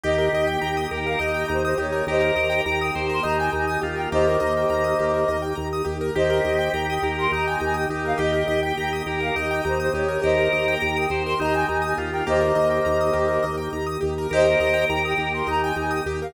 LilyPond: <<
  \new Staff \with { instrumentName = "Flute" } { \time 7/8 \key ees \mixolydian \tempo 4 = 103 ees''8. g''16 g''8 g''16 f''16 ees''8 c''16 c''16 des''8 | <c'' ees''>4 g''16 g''8 c'''16 bes''16 aes''16 aes''16 aes''16 r16 g''16 | <c'' ees''>2~ <c'' ees''>8 r4 | <c'' ees''>4 g''16 g''8 c'''16 bes''16 aes''16 aes''16 g''16 r16 f''16 |
ees''8. g''16 g''8 g''16 f''16 ees''8 c''16 c''16 des''8 | <c'' ees''>4 g''16 g''8 c'''16 bes''16 aes''16 aes''16 aes''16 r16 g''16 | <c'' ees''>2~ <c'' ees''>8 r4 | <c'' ees''>4 g''16 g''8 c'''16 bes''16 aes''16 aes''16 g''16 r16 f''16 | }
  \new Staff \with { instrumentName = "Drawbar Organ" } { \time 7/8 \key ees \mixolydian g'4. bes'8 ees'4 ees'8 | bes'4. c''8 ees'4 f'8 | bes2~ bes8 r4 | g'4. bes'8 ees'4 ees'8 |
g'4. bes'8 ees'4 ees'8 | bes'4. c''8 ees'4 f'8 | bes2~ bes8 r4 | bes'2 ees'4 r8 | }
  \new Staff \with { instrumentName = "Acoustic Grand Piano" } { \time 7/8 \key ees \mixolydian g'16 bes'16 ees''16 g''16 bes''16 ees'''16 g'16 bes'16 ees''16 g''16 bes''16 ees'''16 g'16 bes'16 | g'16 bes'16 ees''16 g''16 bes''16 ees'''16 g'16 bes'16 ees''16 g''16 bes''16 ees'''16 g'16 bes'16 | g'16 bes'16 ees''16 g''16 bes''16 ees'''16 g'16 bes'16 ees''16 g''16 bes''16 ees'''16 g'16 bes'16 | g'16 bes'16 ees''16 g''16 bes''16 ees'''16 g'16 bes'16 ees''16 g''16 bes''16 ees'''16 g'16 bes'16 |
g'16 bes'16 ees''16 g''16 bes''16 ees'''16 g'16 bes'16 ees''16 g''16 bes''16 ees'''16 g'16 bes'16 | g'16 bes'16 ees''16 g''16 bes''16 ees'''16 g'16 bes'16 ees''16 g''16 bes''16 ees'''16 g'16 bes'16 | g'16 bes'16 ees''16 g''16 bes''16 ees'''16 g'16 bes'16 ees''16 g''16 bes''16 ees'''16 g'16 bes'16 | g'16 bes'16 ees''16 g''16 bes''16 ees'''16 g'16 bes'16 ees''16 g''16 bes''16 ees'''16 g'16 bes'16 | }
  \new Staff \with { instrumentName = "Drawbar Organ" } { \clef bass \time 7/8 \key ees \mixolydian ees,8 ees,8 ees,8 ees,8 ees,8 ees,8 ees,8 | ees,8 ees,8 ees,8 ees,8 ees,8 ees,8 ees,8 | ees,8 ees,8 ees,8 ees,8 ees,8 ees,8 ees,8 | ees,8 ees,8 ees,8 ees,8 ees,8 ees,8 ees,8 |
ees,8 ees,8 ees,8 ees,8 ees,8 ees,8 ees,8 | ees,8 ees,8 ees,8 ees,8 ees,8 ees,8 ees,8 | ees,8 ees,8 ees,8 ees,8 ees,8 ees,8 ees,8 | ees,8 ees,8 ees,8 ees,8 ees,8 ees,8 ees,8 | }
  \new Staff \with { instrumentName = "Pad 2 (warm)" } { \time 7/8 \key ees \mixolydian <bes ees' g'>2.~ <bes ees' g'>8 | <bes ees' g'>2.~ <bes ees' g'>8 | <bes ees' g'>2.~ <bes ees' g'>8 | <bes ees' g'>2.~ <bes ees' g'>8 |
<bes ees' g'>2.~ <bes ees' g'>8 | <bes ees' g'>2.~ <bes ees' g'>8 | <bes ees' g'>2.~ <bes ees' g'>8 | <bes ees' g'>2.~ <bes ees' g'>8 | }
>>